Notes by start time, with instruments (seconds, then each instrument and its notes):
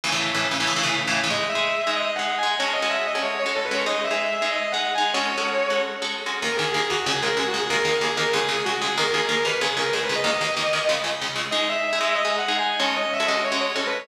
0.04 overdriven guitar A2 C#3 E3
0.12 overdriven guitar A2 C#3 E3
0.34 overdriven guitar A2 C#3 E3
0.51 overdriven guitar A2 C#3 E3
0.60 overdriven guitar A2 C#3 E3
0.67 overdriven guitar A2 C#3 E3
0.76 overdriven guitar A2 C#3 E3
0.83 overdriven guitar A2 C#3 E3
1.07 overdriven guitar A2 C#3 E3
1.24 overdriven guitar A2 C#3 E3
1.30 overdriven guitar G#3 D#4 G#4, distortion guitar D#5
1.49 distortion guitar E5
1.55 overdriven guitar G#3 D#4 G#4
1.87 overdriven guitar G#3 D#4 G#4
1.95 distortion guitar D#5
2.15 overdriven guitar G#3 D#4 G#4, distortion guitar F#5
2.38 distortion guitar G#5
2.43 overdriven guitar G#3 D#4 G#4
2.59 overdriven guitar G#3 C#4 F#4 A4, distortion guitar C#5
2.73 distortion guitar D#5
2.82 overdriven guitar G#3 C#4 F#4 A4
2.90 distortion guitar E5
3.07 distortion guitar D#5
3.15 overdriven guitar G#3 C#4 F#4 A4
3.21 distortion guitar C#5
3.39 distortion guitar C#5
3.46 overdriven guitar G#3 C#4 F#4 A4
3.55 distortion guitar A4
3.64 distortion guitar B4
3.71 overdriven guitar G#3 C#4 F#4 A4, distortion guitar C#5
3.86 overdriven guitar G#3 D#4 G#4, distortion guitar D#5
4.04 distortion guitar E5
4.11 overdriven guitar G#3 D#4 G#4
4.42 overdriven guitar G#3 D#4 G#4
4.51 distortion guitar D#5
4.72 overdriven guitar G#3 D#4 G#4, distortion guitar F#5
4.95 overdriven guitar G#3 D#4 G#4, distortion guitar G#5
5.14 overdriven guitar G#3 C#4 F#4 A4, distortion guitar C#5
5.38 overdriven guitar G#3 C#4 F#4 A4
5.70 overdriven guitar G#3 C#4 F#4 A4
6.02 overdriven guitar G#3 C#4 F#4 A4
6.26 overdriven guitar G#3 C#4 F#4 A4
6.42 overdriven guitar D#2 D#3 A#3, distortion guitar A#4
6.56 overdriven guitar D#2 D#3 A#3, distortion guitar G#4
6.72 overdriven guitar D#2 D#3 A#3, distortion guitar G#4
6.90 overdriven guitar D#2 D#3 A#3, distortion guitar F#4
7.06 overdriven guitar C#2 C#3 G#3, distortion guitar G#4
7.22 overdriven guitar C#2 C#3 G#3, distortion guitar A#4
7.37 overdriven guitar C#2 C#3 G#3, distortion guitar G#4
7.47 distortion guitar F#4
7.54 overdriven guitar C#2 C#3 G#3
7.60 distortion guitar G#4
7.69 overdriven guitar D#2 D#3 A#3, distortion guitar A#4
7.85 overdriven guitar D#2 D#3 A#3
8.01 overdriven guitar D#2 D#3 A#3, distortion guitar G#4
8.16 overdriven guitar D#2 D#3 A#3, distortion guitar A#4
8.33 overdriven guitar C#2 C#3 G#3, distortion guitar G#4
8.49 overdriven guitar C#2 C#3 G#3
8.65 overdriven guitar C#2 C#3 G#3, distortion guitar F#4
8.81 overdriven guitar C#2 C#3 G#3, distortion guitar G#4
8.97 overdriven guitar D#2 D#3 A#3, distortion guitar A#4
9.12 overdriven guitar D#2 D#3 A#3, distortion guitar G#4
9.29 overdriven guitar D#2 D#3 A#3, distortion guitar A#4
9.45 overdriven guitar D#2 D#3 A#3, distortion guitar B4
9.61 overdriven guitar C#2 C#3 G#3, distortion guitar G#4
9.77 overdriven guitar C#2 C#3 G#3, distortion guitar A#4
9.93 overdriven guitar C#2 C#3 G#3, distortion guitar G#4
10.03 distortion guitar B4
10.09 overdriven guitar C#2 C#3 G#3
10.15 distortion guitar D#5
10.24 overdriven guitar D#2 D#3 A#3, distortion guitar D#5
10.41 overdriven guitar D#2 D#3 A#3
10.57 overdriven guitar D#2 D#3 A#3
10.73 overdriven guitar D#2 D#3 A#3
10.89 overdriven guitar C#2 C#3 G#3
11.04 overdriven guitar C#2 C#3 G#3
11.22 overdriven guitar C#2 C#3 G#3
11.36 overdriven guitar C#2 C#3 G#3
11.51 overdriven guitar G#3 D#4 G#4, distortion guitar D#5
11.69 distortion guitar E5
11.93 overdriven guitar G#3 D#4 G#4
12.01 overdriven guitar G#3 D#4 G#4
12.15 distortion guitar D#5
12.25 overdriven guitar G#3 D#4 G#4
12.38 distortion guitar F#5
12.48 overdriven guitar G#3 D#4 G#4
12.58 distortion guitar G#5
12.79 overdriven guitar G#3 C#4 F#4 A4, distortion guitar C#5
12.96 distortion guitar D#5
13.13 distortion guitar E5
13.20 overdriven guitar G#3 C#4 F#4 A4
13.27 overdriven guitar G#3 C#4 F#4 A4, distortion guitar D#5
13.44 distortion guitar C#5
13.52 overdriven guitar G#3 C#4 F#4 A4
13.61 distortion guitar C#5
13.75 overdriven guitar G#3 C#4 F#4 A4, distortion guitar A4
13.86 distortion guitar B4
13.99 distortion guitar C#5